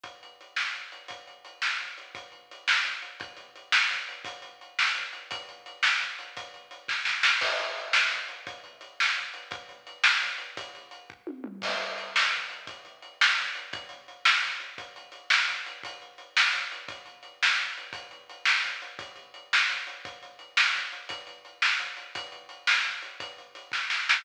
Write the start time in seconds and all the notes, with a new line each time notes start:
0.04 kick, closed hi-hat
0.23 closed hi-hat
0.41 closed hi-hat
0.56 snare
0.74 closed hi-hat
0.92 closed hi-hat
1.08 kick, closed hi-hat
1.27 closed hi-hat
1.45 closed hi-hat
1.62 snare
1.81 closed hi-hat
1.98 closed hi-hat
2.15 kick, closed hi-hat
2.32 closed hi-hat
2.51 closed hi-hat
2.68 snare
2.85 closed hi-hat
3.02 closed hi-hat
3.20 kick, closed hi-hat
3.37 closed hi-hat
3.56 closed hi-hat
3.72 snare
3.91 closed hi-hat
4.09 closed hi-hat
4.25 kick, closed hi-hat
4.42 closed hi-hat
4.61 closed hi-hat
4.79 snare
4.95 closed hi-hat
5.13 closed hi-hat
5.31 kick, closed hi-hat
5.49 closed hi-hat
5.66 closed hi-hat
5.83 snare
6.00 closed hi-hat
6.19 closed hi-hat
6.37 kick, closed hi-hat
6.54 closed hi-hat
6.71 closed hi-hat
6.88 kick, snare
7.05 snare
7.23 snare
7.41 kick, crash
7.60 closed hi-hat
7.77 closed hi-hat
7.93 snare
8.12 closed hi-hat
8.28 closed hi-hat
8.47 kick, closed hi-hat
8.64 closed hi-hat
8.81 closed hi-hat
9.00 snare
9.17 closed hi-hat
9.34 closed hi-hat
9.51 kick, closed hi-hat
9.69 closed hi-hat
9.87 closed hi-hat
10.04 snare
10.22 closed hi-hat
10.38 closed hi-hat
10.57 kick, closed hi-hat
10.75 closed hi-hat
10.91 closed hi-hat
11.10 kick
11.27 high tom
11.44 mid tom
11.62 kick, crash
11.81 closed hi-hat
11.98 closed hi-hat
12.16 snare
12.33 closed hi-hat
12.50 closed hi-hat
12.67 kick, closed hi-hat
12.85 closed hi-hat
13.02 closed hi-hat
13.21 snare
13.38 closed hi-hat
13.55 closed hi-hat
13.73 kick, closed hi-hat
13.89 closed hi-hat
14.08 closed hi-hat
14.25 snare
14.43 closed hi-hat
14.60 closed hi-hat
14.78 kick, closed hi-hat
14.96 closed hi-hat
15.12 closed hi-hat
15.30 snare
15.48 closed hi-hat
15.66 closed hi-hat
15.83 kick, closed hi-hat
16.02 closed hi-hat
16.18 closed hi-hat
16.37 snare
16.53 closed hi-hat
16.72 closed hi-hat
16.89 kick, closed hi-hat
17.06 closed hi-hat
17.23 closed hi-hat
17.43 snare
17.59 closed hi-hat
17.78 closed hi-hat
17.93 kick, closed hi-hat
18.11 closed hi-hat
18.30 closed hi-hat
18.45 snare
18.64 closed hi-hat
18.82 closed hi-hat
18.99 kick, closed hi-hat
19.16 closed hi-hat
19.34 closed hi-hat
19.53 snare
19.70 closed hi-hat
19.87 closed hi-hat
20.05 kick, closed hi-hat
20.23 closed hi-hat
20.39 closed hi-hat
20.57 snare
20.75 closed hi-hat
20.92 closed hi-hat
21.09 kick, closed hi-hat
21.27 closed hi-hat
21.45 closed hi-hat
21.62 snare
21.79 closed hi-hat
21.97 closed hi-hat
22.15 kick, closed hi-hat
22.32 closed hi-hat
22.49 closed hi-hat
22.67 snare
22.85 closed hi-hat
23.02 closed hi-hat
23.20 kick, closed hi-hat
23.38 closed hi-hat
23.55 closed hi-hat
23.72 kick, snare
23.90 snare
24.09 snare